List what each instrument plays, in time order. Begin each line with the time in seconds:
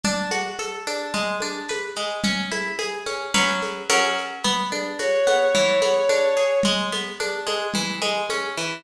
0.03 acoustic guitar (steel) D4, low conga, shaker
0.31 acoustic guitar (steel) F#4, high conga, shaker
0.58 acoustic guitar (steel) A4, high conga, shaker
0.87 acoustic guitar (steel) D4, high conga, shaker
1.14 acoustic guitar (steel) G#3, low conga, shaker
1.40 acoustic guitar (steel) D4, high conga, shaker
1.68 acoustic guitar (steel) B4, high conga, shaker
1.96 acoustic guitar (steel) G#3, shaker
2.23 acoustic guitar (steel) C#4, low conga, shaker
2.51 acoustic guitar (steel) E4, high conga, shaker
2.79 acoustic guitar (steel) G#4, high conga, shaker
3.06 acoustic guitar (steel) C#4, high conga, shaker
3.34 acoustic guitar (steel) F#3 C#4 B4, low conga, shaker
3.62 high conga, shaker
3.89 acoustic guitar (steel) F#3 C#4 A#4, high conga, shaker
4.18 shaker
4.43 acoustic guitar (steel) B3, low conga, shaker
4.71 acoustic guitar (steel) D4, high conga, shaker
4.99 acoustic guitar (steel) F#4, violin C#5, high conga, shaker
5.27 acoustic guitar (steel) B3, high conga, shaker
5.55 acoustic guitar (steel) E3, low conga, shaker
5.82 acoustic guitar (steel) B3, high conga, shaker
6.09 acoustic guitar (steel) D4, high conga, shaker
6.37 acoustic guitar (steel) G#4, shaker
6.63 acoustic guitar (steel) G#3, low conga, shaker
6.92 acoustic guitar (steel) B3, high conga, shaker
7.20 acoustic guitar (steel) D4, high conga, shaker
7.47 acoustic guitar (steel) G#3, high conga, shaker
7.74 acoustic guitar (steel) E3, low conga, shaker
8.02 acoustic guitar (steel) G#3, high conga, shaker
8.30 acoustic guitar (steel) C#4, high conga, shaker
8.57 acoustic guitar (steel) E3, shaker